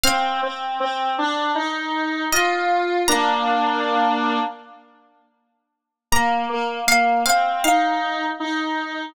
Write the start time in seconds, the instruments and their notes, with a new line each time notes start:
0.03 lead 1 (square) C4, pizzicato strings F5
0.43 lead 1 (square) C4
0.80 lead 1 (square) C4
1.18 lead 1 (square) D4
1.55 lead 1 (square) D#4
2.32 lead 1 (square) F4, pizzicato strings D#5
3.08 lead 1 (square) A#3 D4, pizzicato strings A#5
6.12 lead 1 (square) A#3, pizzicato strings A#5
6.49 lead 1 (square) A#3
6.87 lead 1 (square) A#3, pizzicato strings F5
7.26 lead 1 (square) C4, pizzicato strings F5
7.64 lead 1 (square) D#4, pizzicato strings F5
8.40 lead 1 (square) D#4